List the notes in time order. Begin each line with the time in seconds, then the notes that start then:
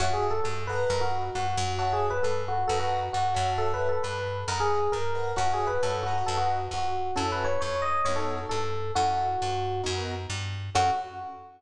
0.00 F#2 F#4 C#5 E5 F#5 A5
0.13 G#4
0.31 A4
0.44 G2 A4
0.67 B4 D#5 F#5 A#5
0.90 F#2 A#4
1.01 F#4
1.35 G2 F#4
1.57 F#2
1.79 F#4 C#5 E5 F#5 A5
1.93 G#4
2.10 B4
2.23 G2 A4
2.48 F#4
2.68 F#2 A4 B4 D#5 F#5 A#5
2.80 F#4
3.13 G2 F#4
3.34 F#2 C#5 E5 F#5 A5
3.58 A4
3.74 B4
3.89 A4
4.03 G2 B4
4.48 F#2 A#4 B4 D#5 F#5 A#5
4.60 G#4
4.92 G2 A#4
5.15 B4 D#5 F#5 A#5
5.36 F#2 F#4 C#5 E5 F#5 A5
5.53 G#4
5.67 B4
5.83 G2 A4 C#5 E5 F#5 A5
6.03 F#4 B4 D#5 F#5 A#5
6.26 F#2 A4
6.37 F#4
6.71 F2 F#4
7.16 F#2 C#4 E4 F#4 A4
7.32 B4
7.44 C#5
7.61 F2 C#5
7.82 D#5
8.05 F#2 B3 D#4 F#4 A#4 C#5
8.16 A4
8.49 G2 A4
8.95 F#2 C#4 E4 F#4 A4
9.42 G2
9.83 F#2 B3 D#4 F#4 A#4
10.30 G2
10.75 F#2 C#4 E4 F#4 A4